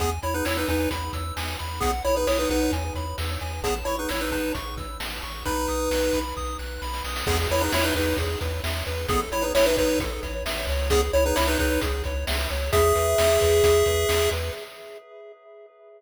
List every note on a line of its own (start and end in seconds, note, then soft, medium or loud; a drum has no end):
0.00 0.19 E2 medium
0.00 0.10 B3 medium
0.00 0.10 G#4 medium
0.00 0.20 G#5 medium
0.00 kick medium
0.00 closed hi-hat loud
0.23 0.42 E2 medium
0.23 0.34 E4 medium
0.23 0.34 C#5 medium
0.23 0.43 B5 soft
0.23 closed hi-hat medium
0.34 0.45 D#4 medium
0.34 0.45 B4 medium
0.45 0.65 E2 medium
0.45 0.56 E4 medium
0.45 0.56 C#5 medium
0.45 0.66 E6 medium
0.45 snare loud
0.57 0.68 D#4 medium
0.57 0.68 B4 medium
0.68 0.88 E2 medium
0.68 0.89 D#4 medium
0.68 0.89 B4 medium
0.68 0.89 G#5 soft
0.68 kick medium
0.68 closed hi-hat medium
0.91 1.10 E2 medium
0.91 1.11 B5 medium
0.91 kick medium
0.91 closed hi-hat loud
1.13 1.32 E2 medium
1.13 1.34 E6 medium
1.13 kick medium
1.13 closed hi-hat medium
1.36 1.56 E2 medium
1.36 1.57 G#5 medium
1.36 snare loud
1.59 1.80 E2 medium
1.59 1.80 B5 soft
1.59 closed hi-hat medium
1.80 2.01 B1 medium
1.80 1.91 B3 medium
1.80 1.91 G#4 medium
1.80 2.02 F#5 medium
1.80 kick loud
1.80 closed hi-hat loud
2.04 2.24 B1 medium
2.04 2.15 E4 medium
2.04 2.15 C#5 medium
2.04 2.25 B5 medium
2.04 closed hi-hat medium
2.16 2.27 D#4 medium
2.16 2.27 B4 medium
2.27 2.46 B1 medium
2.27 2.38 E4 medium
2.27 2.38 C#5 medium
2.27 2.48 D#6 medium
2.27 snare loud
2.39 2.50 D#4 medium
2.39 2.50 B4 medium
2.50 2.69 B1 medium
2.50 2.72 D#4 medium
2.50 2.72 B4 medium
2.50 2.70 F#5 soft
2.50 kick medium
2.50 closed hi-hat medium
2.71 2.91 E2 medium
2.71 2.93 G#5 medium
2.71 kick medium
2.71 closed hi-hat medium
2.95 3.14 E2 medium
2.95 3.16 B5 soft
2.95 kick medium
2.95 closed hi-hat medium
3.18 3.37 E2 medium
3.18 3.39 E6 soft
3.18 snare loud
3.41 3.61 E2 medium
3.41 3.61 G#5 medium
3.41 closed hi-hat medium
3.63 3.82 A1 medium
3.63 3.74 B3 medium
3.63 3.74 G#4 medium
3.63 3.84 A5 medium
3.63 kick loud
3.63 closed hi-hat loud
3.85 4.05 A1 medium
3.85 3.96 E4 medium
3.85 3.96 C#5 medium
3.85 4.07 C#6 medium
3.85 closed hi-hat medium
3.99 4.10 D#4 medium
3.99 4.10 B4 medium
4.09 4.30 A1 medium
4.09 4.21 E4 medium
4.09 4.21 C#5 medium
4.09 4.30 E6 medium
4.09 snare loud
4.21 4.31 D#4 medium
4.21 4.31 B4 medium
4.31 4.51 A1 medium
4.31 4.52 D#4 medium
4.31 4.52 B4 medium
4.31 4.52 A5 medium
4.31 kick medium
4.31 closed hi-hat medium
4.55 4.74 A1 medium
4.55 4.75 C#6 medium
4.55 kick medium
4.55 closed hi-hat medium
4.76 4.95 A1 medium
4.76 4.98 E6 medium
4.76 kick loud
4.76 closed hi-hat medium
5.00 5.19 A1 medium
5.00 5.20 A5 soft
5.00 snare loud
5.22 5.42 A1 medium
5.22 5.43 C#6 medium
5.22 closed hi-hat medium
5.45 5.66 B1 medium
5.45 6.19 D#4 medium
5.45 6.19 B4 medium
5.45 5.66 B5 medium
5.45 kick loud
5.45 closed hi-hat medium
5.68 5.88 B1 medium
5.68 5.89 D#6 medium
5.68 closed hi-hat medium
5.91 6.10 B1 medium
5.91 6.11 F#6 medium
5.91 snare loud
6.13 6.32 B1 medium
6.13 6.34 B5 medium
6.13 kick medium
6.13 closed hi-hat medium
6.36 6.56 B1 medium
6.36 6.57 D#6 medium
6.36 kick medium
6.36 snare medium
6.59 6.78 B1 medium
6.59 6.80 F#6 medium
6.59 snare medium
6.82 7.01 B1 medium
6.82 7.02 B5 medium
6.82 snare medium
6.93 snare medium
7.04 7.23 B1 medium
7.04 7.25 D#6 soft
7.04 snare medium
7.16 snare loud
7.26 7.47 E2 loud
7.26 7.38 B3 medium
7.26 7.38 G#4 medium
7.26 7.48 G#4 medium
7.26 kick loud
7.26 crash loud
7.49 7.69 E2 medium
7.49 7.62 E4 medium
7.49 7.70 B4 medium
7.49 7.62 C#5 medium
7.49 closed hi-hat medium
7.61 7.72 D#4 medium
7.61 7.72 B4 medium
7.72 7.92 E2 medium
7.72 7.85 E4 medium
7.72 7.85 C#5 medium
7.72 7.93 E5 medium
7.72 snare loud
7.84 7.94 D#4 medium
7.84 7.94 B4 medium
7.95 8.14 E2 medium
7.95 8.17 D#4 medium
7.95 8.16 B4 medium
7.95 8.17 B4 medium
7.95 kick loud
7.95 closed hi-hat medium
8.17 8.36 E2 medium
8.17 8.39 G#4 medium
8.17 kick medium
8.17 closed hi-hat loud
8.41 8.61 E2 medium
8.41 8.61 B4 medium
8.41 kick medium
8.41 closed hi-hat medium
8.64 8.83 E2 medium
8.64 8.84 E5 medium
8.64 snare loud
8.86 9.06 E2 medium
8.86 9.07 B4 medium
8.86 closed hi-hat medium
9.08 9.28 A1 medium
9.08 9.20 B3 medium
9.08 9.20 G#4 medium
9.08 9.30 A4 medium
9.08 kick loud
9.08 closed hi-hat loud
9.32 9.51 A1 medium
9.32 9.43 E4 medium
9.32 9.52 C#5 medium
9.32 9.43 C#5 medium
9.32 closed hi-hat medium
9.42 9.53 D#4 medium
9.42 9.53 B4 medium
9.55 9.74 A1 medium
9.55 9.65 E4 medium
9.55 9.65 C#5 medium
9.55 9.75 E5 medium
9.55 snare loud
9.66 9.77 D#4 medium
9.66 9.77 B4 medium
9.77 9.97 A1 medium
9.77 9.99 D#4 medium
9.77 9.99 B4 medium
9.77 9.98 C#5 medium
9.77 kick loud
9.77 closed hi-hat medium
9.99 10.18 A1 medium
9.99 10.20 A4 medium
9.99 kick loud
9.99 closed hi-hat loud
10.23 10.43 A1 medium
10.23 10.43 C#5 medium
10.23 kick medium
10.23 closed hi-hat medium
10.45 10.65 A1 medium
10.45 10.66 E5 medium
10.45 snare loud
10.67 11.09 C#2 medium
10.67 10.89 C#5 medium
10.67 open hi-hat medium
10.90 11.01 B3 medium
10.90 11.01 G#4 medium
10.90 11.11 G#4 medium
10.90 kick loud
10.90 closed hi-hat loud
11.13 11.32 C#2 medium
11.13 11.24 E4 medium
11.13 11.24 C#5 medium
11.13 11.34 C#5 medium
11.13 closed hi-hat medium
11.26 11.36 D#4 medium
11.26 11.36 B4 medium
11.36 11.57 C#2 medium
11.36 11.47 E4 medium
11.36 11.47 C#5 medium
11.36 11.57 E5 medium
11.36 snare loud
11.47 11.58 D#4 medium
11.47 11.58 B4 medium
11.59 11.78 C#2 medium
11.59 11.81 D#4 medium
11.59 11.81 B4 medium
11.59 11.79 C#5 medium
11.59 kick loud
11.59 closed hi-hat medium
11.81 12.02 C#2 medium
11.81 12.02 G#4 medium
11.81 kick loud
11.81 closed hi-hat loud
12.04 12.24 C#2 medium
12.04 12.25 C#5 medium
12.04 kick medium
12.04 closed hi-hat medium
12.27 12.47 C#2 medium
12.27 12.48 E5 medium
12.27 snare loud
12.50 12.70 C#2 medium
12.50 12.70 C#5 medium
12.50 closed hi-hat medium
12.73 12.93 E2 medium
12.73 14.30 G#4 medium
12.73 12.93 G#4 medium
12.73 14.30 E5 loud
12.73 kick loud
12.73 closed hi-hat loud
12.95 13.15 E2 medium
12.95 13.16 B4 medium
12.95 closed hi-hat medium
13.18 13.38 E2 medium
13.18 13.39 E5 medium
13.18 snare loud
13.41 13.62 E2 medium
13.41 13.61 B4 medium
13.41 kick medium
13.41 closed hi-hat medium
13.63 13.83 E2 medium
13.63 13.84 G#4 medium
13.63 kick loud
13.63 closed hi-hat loud
13.86 14.05 E2 medium
13.86 14.07 B4 medium
13.86 kick medium
13.86 closed hi-hat medium
14.09 14.28 E2 medium
14.09 14.30 E5 medium
14.09 snare loud
14.31 14.50 E2 medium
14.31 14.52 B4 medium
14.31 closed hi-hat medium